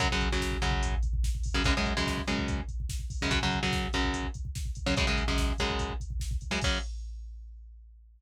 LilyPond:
<<
  \new Staff \with { instrumentName = "Overdriven Guitar" } { \clef bass \time 4/4 \key fis \dorian \tempo 4 = 145 <fis, cis fis>16 <fis, cis fis>8 <fis, cis fis>8. <fis, cis fis>2~ <fis, cis fis>16 <fis, cis fis>16 | <fis, cis gis>16 <fis, cis gis>8 <fis, cis gis>8. <fis, cis gis>2~ <fis, cis gis>16 <fis, cis gis>16 | <fis, cis fis>16 <fis, cis fis>8 <fis, cis fis>8. <fis, cis fis>2~ <fis, cis fis>16 <fis, cis fis>16 | <fis, cis gis>16 <fis, cis gis>8 <fis, cis gis>8. <fis, cis gis>2~ <fis, cis gis>16 <fis, cis gis>16 |
<fis, cis fis>4 r2. | }
  \new DrumStaff \with { instrumentName = "Drums" } \drummode { \time 4/4 <hh bd>16 bd16 <hh bd>16 bd16 <bd sn>16 bd16 <hh bd>16 bd16 <hh bd>16 bd16 <hh bd>16 bd16 <bd sn>16 bd16 <hho bd>16 bd16 | <hh bd>16 bd16 <hh bd>16 bd16 <bd sn>16 bd16 <hh bd>16 bd16 <hh bd>16 bd16 <hh bd>16 bd16 <bd sn>16 bd16 <hho bd>16 bd16 | <hh bd>16 bd16 <hh bd>16 bd16 <bd sn>16 bd16 <hh bd>16 bd16 <hh bd>16 bd16 <hh bd>16 bd16 <bd sn>16 bd16 <hh bd>16 bd16 | <hh bd>16 bd16 <hh bd>16 bd16 <bd sn>16 bd16 <hh bd>16 bd16 <hh bd>16 bd16 <hh bd>16 bd16 <bd sn>16 bd16 <hh bd>16 bd16 |
<cymc bd>4 r4 r4 r4 | }
>>